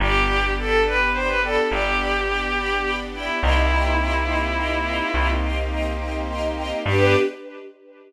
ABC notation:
X:1
M:12/8
L:1/16
Q:3/8=70
K:G
V:1 name="Violin"
G4 A2 B2 c B A2 G10 E2 | E16 z8 | G6 z18 |]
V:2 name="String Ensemble 1"
[dgb]2 [dgb]2 [dgb]2 [dgb]2 [dgb]2 [dgb]2 [dgb]2 [dgb]2 [dgb]2 [dgb]2 [dgb]2 [dgb]2 | [_eg_bc']2 [egbc']2 [egbc']2 [egbc']2 [egbc']2 [egbc']2 [egbc']2 [egbc']2 [egbc']2 [egbc']2 [egbc']2 [egbc']2 | [DGB]6 z18 |]
V:3 name="Electric Bass (finger)" clef=bass
G,,,12 G,,,12 | C,,12 C,,12 | G,,6 z18 |]
V:4 name="String Ensemble 1"
[B,DG]24 | [_B,C_EG]24 | [B,DG]6 z18 |]